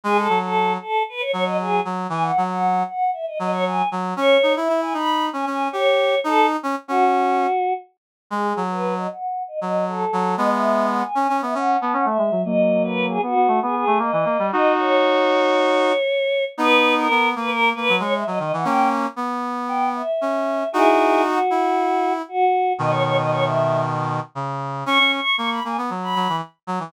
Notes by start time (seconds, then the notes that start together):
0.04 G#3 G#4
0.16 A4
0.29 F#3
0.41 A4
0.80 A4
1.09 B4
1.20 C#5
1.32 F#3 C#5
1.45 D#5
1.60 G#4
1.85 F#3
2.09 E3 G#5
2.22 F#5
2.37 F#3
2.50 F#5
2.88 F#5
3.13 E5
3.27 D#5
3.39 F#3 D#5
3.52 C#5
3.66 G#5
3.91 F#3
4.16 C#4 C#5
4.43 D#4
4.56 E4 E5
4.69 E4
4.81 G#5
4.94 D#4 B5
5.33 C#4 G#5
5.46 C#4 G#5
5.71 G4 C#5
6.24 D#4 A4
6.63 C#4
6.88 C#4 F#4
8.30 G#3 G#4
8.56 F#3
8.70 B4
8.97 D#5
9.10 F#5
9.48 D#5
9.60 F#3 D#5
9.87 A4
10.13 F#3
10.37 G#3 B3 D#5
10.53 E5
10.91 F#5
11.02 G#5
11.15 C#4
11.29 C#4
11.42 B3 E5
11.54 C#4 F#5
11.79 B3 A5
11.93 C#4 F#5
12.05 A3 E5
12.18 G#3
12.31 F#3
12.45 F#3 A#3 D#5
12.83 B4
13.09 G#4
13.22 B3 F#4
13.35 B3
13.48 A3
13.62 B3 G#4
13.75 G#4
13.87 A3
13.99 A#3 D#5
14.12 E3
14.25 A#3
14.39 G3
14.51 D#4 F#4 D#5
14.78 C#5
16.58 B3 D#4 B4
16.97 A#4
17.10 B3
17.36 A#3 B4
17.48 A#4
17.75 A#3 B4
17.89 F#3
18.00 G#3 C#5
18.14 E5
18.26 F#3 D#5
18.39 D#3 D#5
18.53 E3 F#5
18.64 A#3 C#4 G5
19.16 B3
19.68 G5
19.95 E5
20.21 C#4
20.72 D#4 E4 F#4 G#4
21.24 F#4
21.50 E4
22.28 F#4
22.78 B2 D#3 D#5
22.90 C#5
23.04 C#5
23.18 D#5
23.31 C#5
23.43 E5
24.35 C#3
24.86 C#4 C#6
24.99 C#4
25.14 C#6
25.37 A#3 C#6
25.50 B5
25.64 A#3 G#5
25.78 B3
25.90 F#3
26.01 B5
26.15 F#3
26.29 E3
26.67 F#3
26.80 E3